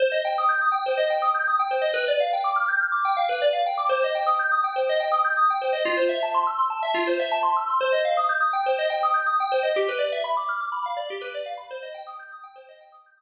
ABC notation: X:1
M:4/4
L:1/16
Q:1/4=123
K:Cdor
V:1 name="Electric Piano 2"
c e g e' g' e' g c e g e' g' e' g c e | =B d f g d' f' g' f' d' g f B d f g d' | c e g e' g' e' g c e g e' g' e' g c e | F c =e a c' =e' c' a e F c e a c' e' c' |
c e f e' g' e' g c e g e' g' e' g c e | G =B d =e =b d' f' d' b f d G B d f b | c e g e' g' e' g c e g e' g' e' z3 |]